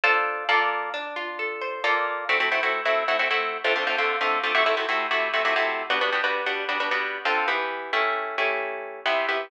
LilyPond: \new Staff { \time 2/4 \key d \minor \tempo 4 = 133 <d' f' a' c''>4 <bes f' a' d''>4 | \time 3/4 d'8 f'8 a'8 c''8 <bes f' a' d''>4 | \key a \minor <a c' e' fis'>16 <a c' e' fis'>16 <a c' e' fis'>16 <a c' e' fis'>8 <a c' e' fis'>8 <a c' e' fis'>16 <a c' e' fis'>16 <a c' e' fis'>8. | \time 2/4 <d a c' f'>16 <d a c' f'>16 <d a c' f'>16 <d a c' f'>8 <d a c' f'>8 <d a c' f'>16 |
\time 3/4 <c a e' fis'>16 <c a e' fis'>16 <c a e' fis'>16 <c a e' fis'>8 <c a e' fis'>8 <c a e' fis'>16 <c a e' fis'>16 <c a e' fis'>8. | <g b d' fis'>16 <g b d' fis'>16 <g b d' fis'>16 <g b d' fis'>8 <g b d' fis'>8 <g b d' fis'>16 <g b d' fis'>16 <g b d' fis'>8. | \time 2/4 \key d \minor <d c' f' a'>8 <e b g'>4 <a cis' e' g'>8~ | \time 3/4 <a cis' e' g'>8 <a cis' e' g'>4. <c b e' g'>8 <c b e' g'>8 | }